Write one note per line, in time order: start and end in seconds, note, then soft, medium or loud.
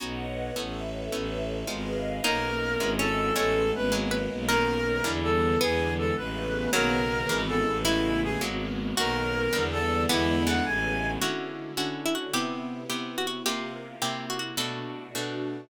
0.00 0.51 B1 medium
0.00 0.26 B3 medium
0.00 0.26 C#4 medium
0.00 0.26 D#4 medium
0.00 0.26 F#4 medium
0.00 0.55 B4 medium
0.00 0.55 C#5 medium
0.00 0.55 D#5 medium
0.00 0.55 F#5 medium
0.56 1.09 A1 medium
0.56 0.82 A3 medium
0.56 0.82 B3 medium
0.56 0.82 C#4 medium
0.56 0.82 E4 medium
0.56 1.12 A4 medium
0.56 1.12 B4 medium
0.56 1.12 C#5 medium
0.56 1.12 E5 medium
1.12 1.64 A1 medium
1.12 1.38 A3 medium
1.12 1.38 B3 medium
1.12 1.38 C#4 medium
1.12 1.38 E4 medium
1.12 1.68 A4 medium
1.12 1.68 B4 medium
1.12 1.68 C#5 medium
1.12 1.68 E5 medium
1.67 2.20 G#1 medium
1.67 1.94 G#3 medium
1.67 1.94 B3 medium
1.67 1.94 D#4 medium
1.67 1.94 F4 medium
1.67 2.24 G#4 medium
1.67 2.24 B4 medium
1.67 2.24 D#5 medium
1.67 2.24 F5 medium
2.24 2.77 B1 medium
2.24 2.50 A#3 loud
2.24 2.80 A#3 medium
2.24 2.50 B3 medium
2.24 2.79 B3 medium
2.24 2.50 C#4 medium
2.24 2.79 C#4 medium
2.24 2.50 D#4 medium
2.24 2.80 D#4 medium
2.24 2.86 D#4 medium
2.24 2.90 A#4 loud
2.80 3.32 G#1 medium
2.80 3.35 G#3 medium
2.80 3.06 G#3 medium
2.80 3.35 B3 medium
2.80 3.06 B3 medium
2.80 3.35 C#4 medium
2.80 3.06 C#4 medium
2.80 3.35 E4 medium
2.80 3.06 E4 medium
2.99 3.34 C#4 medium
2.99 3.34 A4 medium
3.36 3.72 A1 medium
3.36 3.91 G#3 medium
3.36 3.62 G#3 loud
3.36 3.91 A3 medium
3.36 3.62 A3 medium
3.36 3.91 B3 medium
3.36 3.62 B3 medium
3.36 3.91 C#4 medium
3.36 3.62 C#4 medium
3.36 3.71 A4 medium
3.36 3.97 C#5 medium
3.75 4.28 G#1 medium
3.75 3.93 B4 medium
3.92 4.18 F#3 medium
3.92 4.48 F#3 medium
3.92 4.18 G#3 medium
3.92 4.48 G#3 medium
3.92 4.18 A#3 medium
3.92 4.48 A#3 medium
3.92 4.18 B3 medium
3.92 4.48 B3 medium
4.11 4.47 B4 medium
4.31 5.01 B1 medium
4.48 4.76 D#3 medium
4.48 5.05 D#3 medium
4.48 4.76 A#3 medium
4.48 5.05 A#3 medium
4.48 4.76 B3 medium
4.48 5.04 B3 medium
4.48 4.76 C#4 medium
4.48 5.05 C#4 medium
4.48 5.08 A#4 loud
4.48 5.58 A#4 medium
5.04 5.56 E2 medium
5.04 5.59 D3 medium
5.04 5.30 D3 medium
5.04 5.59 E3 medium
5.04 5.30 E3 medium
5.04 5.60 G3 medium
5.04 5.30 G3 loud
5.04 5.59 B3 medium
5.04 5.30 B3 medium
5.23 5.58 A4 medium
5.60 6.11 E2 medium
5.60 6.15 D3 medium
5.60 6.15 E3 medium
5.60 6.15 G#3 medium
5.60 6.15 B3 medium
5.60 6.30 B3 medium
5.60 5.93 G#4 medium
5.98 6.15 A4 medium
6.16 6.68 A1 medium
6.16 6.73 C#3 medium
6.16 6.73 G#3 medium
6.16 6.73 A3 medium
6.16 6.73 B3 loud
6.16 6.70 B4 medium
6.72 7.24 B1 medium
6.72 7.00 C#3 medium
6.72 7.28 C#3 medium
6.72 7.00 D#3 medium
6.72 7.30 D#3 medium
6.72 7.75 F#3 medium
6.72 7.00 A#3 medium
6.72 7.30 A#3 medium
6.72 7.00 B3 medium
6.72 7.28 B3 loud
6.72 7.41 A#4 loud
7.29 7.64 G#1 medium
7.29 7.84 C#3 medium
7.29 7.55 C#3 medium
7.29 7.84 E3 medium
7.29 7.55 E3 medium
7.29 7.84 G#3 loud
7.29 7.55 G#3 medium
7.29 7.84 B3 medium
7.29 7.55 B3 medium
7.48 7.78 A4 medium
7.66 8.37 A1 loud
7.85 8.11 C#3 medium
7.85 8.41 C#3 medium
7.85 8.11 G#3 medium
7.85 8.41 G#3 medium
7.85 8.11 A3 medium
7.85 8.41 A3 medium
7.85 8.11 B3 loud
7.85 8.41 B3 medium
7.85 8.21 E4 medium
7.85 8.94 E4 medium
8.23 8.41 G#4 medium
8.41 8.93 G#1 medium
8.41 8.67 F#3 medium
8.41 8.97 F#3 medium
8.41 8.67 G#3 medium
8.41 8.97 G#3 medium
8.41 8.67 A#3 medium
8.41 8.97 A#3 medium
8.41 8.67 B3 loud
8.41 8.97 B3 medium
8.97 9.49 B1 medium
8.97 9.24 D#3 medium
8.97 9.54 D#3 medium
8.97 9.24 A#3 medium
8.97 9.54 A#3 medium
8.97 9.24 B3 medium
8.97 9.53 B3 medium
8.97 9.24 C#4 medium
8.97 9.54 C#4 medium
8.97 9.88 F#4 medium
8.97 9.63 A#4 loud
9.53 10.05 E2 medium
9.53 9.79 D3 medium
9.53 10.09 D3 medium
9.53 9.79 E3 medium
9.53 10.09 E3 medium
9.53 9.79 G3 medium
9.53 10.09 G3 medium
9.53 9.79 B3 medium
9.53 10.09 B3 medium
9.72 10.03 A4 medium
10.09 10.60 E2 medium
10.09 10.35 D3 loud
10.09 10.66 D3 loud
10.09 10.35 E3 medium
10.09 10.66 E3 medium
10.09 10.35 G#3 medium
10.09 10.65 G#3 loud
10.09 10.35 B3 medium
10.09 10.42 B3 medium
10.09 10.65 B3 medium
10.09 10.43 E4 medium
10.46 10.92 C#3 medium
10.46 10.92 G#3 medium
10.46 10.92 A3 medium
10.46 10.92 B3 medium
10.46 10.64 F#5 medium
10.66 11.17 A1 loud
10.66 11.21 C#3 loud
10.66 11.21 G#3 medium
10.66 11.21 A3 medium
10.66 11.21 B3 medium
10.66 11.11 G#5 medium
11.21 11.72 D3 loud
11.21 12.33 D3 medium
11.21 11.72 C#4 loud
11.21 12.33 C#4 medium
11.21 11.72 E4 loud
11.21 12.33 E4 medium
11.21 11.69 F#4 medium
11.21 11.72 F#4 medium
11.21 12.33 F#4 medium
11.77 12.28 D3 medium
11.77 12.28 C#4 medium
11.77 12.28 E4 medium
11.77 12.28 F#4 medium
11.77 12.01 F#4 medium
12.06 12.14 E4 medium
12.15 12.33 F#4 medium
12.33 12.84 C3 loud
12.33 13.45 C3 medium
12.33 12.84 B3 medium
12.33 13.45 B3 medium
12.33 12.84 E4 loud
12.33 13.45 E4 medium
12.33 12.84 G4 loud
12.33 12.83 G4 medium
12.33 13.45 G4 medium
12.90 13.40 C3 medium
12.90 13.40 B3 medium
12.90 13.40 E4 medium
12.90 13.40 G4 medium
12.90 13.16 G4 medium
13.18 13.27 F#4 medium
13.27 13.43 F#4 medium
13.46 13.96 C3 loud
13.46 14.01 C3 medium
13.46 13.96 A#3 loud
13.46 14.01 A#3 medium
13.46 13.96 F4 medium
13.46 14.03 F4 medium
13.46 13.96 G4 loud
13.46 14.00 G4 medium
13.46 14.01 G4 medium
14.01 14.57 C3 medium
14.01 14.52 C3 loud
14.01 14.57 A#3 medium
14.01 14.52 A#3 loud
14.01 14.57 E4 medium
14.01 14.52 E4 medium
14.01 14.57 G4 medium
14.01 14.52 G4 loud
14.01 14.26 G4 medium
14.30 14.39 F#4 medium
14.39 14.56 F#4 medium
14.57 15.08 B2 loud
14.57 15.69 B2 medium
14.57 15.08 A3 medium
14.57 15.69 A3 medium
14.57 15.08 D4 loud
14.57 15.69 D4 medium
14.57 15.08 F#4 loud
14.57 15.69 F#4 medium
14.57 15.09 A4 medium
15.15 15.65 B2 medium
15.15 15.65 A3 medium
15.15 15.65 D4 medium
15.15 15.65 F#4 medium